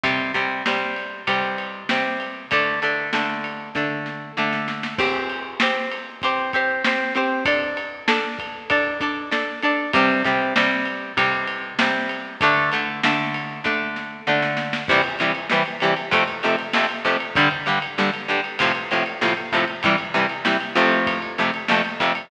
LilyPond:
<<
  \new Staff \with { instrumentName = "Acoustic Guitar (steel)" } { \time 4/4 \key c \mixolydian \tempo 4 = 97 <c g c'>8 <c g c'>8 <c g c'>4 <c g c'>4 <c g c'>4 | <d a d'>8 <d a d'>8 <d a d'>4 <d a d'>4 <d a d'>4 | <c' g' c''>4 <c' g' c''>4 <c' g' c''>8 <c' g' c''>8 <c' g' c''>8 <c' g' c''>8 | <d' a' d''>4 <d' a' d''>4 <d' a' d''>8 <d' a' d''>8 <d' a' d''>8 <d' a' d''>8 |
<c g c'>8 <c g c'>8 <c g c'>4 <c g c'>4 <c g c'>4 | <d a d'>8 <d a d'>8 <d a d'>4 <d a d'>4 <d a d'>4 | <c e g>8 <c e g>8 <c e g>8 <c e g>8 <f, c a>8 <f, c a>8 <f, c a>8 <f, c a>8 | <g, d g>8 <g, d g>8 <g, d g>8 <g, d g>8 <a, c f>8 <a, c f>8 <a, c f>8 <a, c f>8 |
<c e g>8 <c e g>8 <c e g>8 <f, c a>4 <f, c a>8 <f, c a>8 <f, c a>8 | }
  \new DrumStaff \with { instrumentName = "Drums" } \drummode { \time 4/4 <bd cymr>8 <bd cymr>8 sn8 cymr8 <bd cymr>8 cymr8 sn8 cymr8 | <bd cymr>8 cymr8 sn8 cymr8 <bd sn>8 sn8 sn16 sn16 sn16 sn16 | <cymc bd>8 cymr8 sn8 cymr8 <bd cymr>8 <bd cymr>8 sn8 cymr8 | <bd cymr>8 cymr8 sn8 <bd cymr>8 <bd cymr>8 <bd cymr>8 sn8 cymr8 |
<bd cymr>8 <bd cymr>8 sn8 cymr8 <bd cymr>8 cymr8 sn8 cymr8 | <bd cymr>8 cymr8 sn8 cymr8 <bd sn>8 sn8 sn16 sn16 sn16 sn16 | <cymc bd>16 cymr16 cymr16 cymr16 sn16 cymr16 <cymr sn>16 cymr16 <bd cymr>16 cymr16 cymr16 cymr16 sn16 cymr16 <bd cymr>16 cymr16 | <bd cymr>16 cymr16 cymr16 cymr16 sn16 cymr16 <cymr sn>16 cymr16 <bd cymr>16 cymr16 cymr16 cymr16 sn16 cymr16 <bd cymr>16 cymr16 |
<bd cymr>16 cymr16 cymr16 cymr16 sn16 cymr16 <cymr sn>16 cymr16 <bd cymr>16 cymr16 cymr16 cymr16 sn16 cymr16 <bd cymr>16 cymr16 | }
>>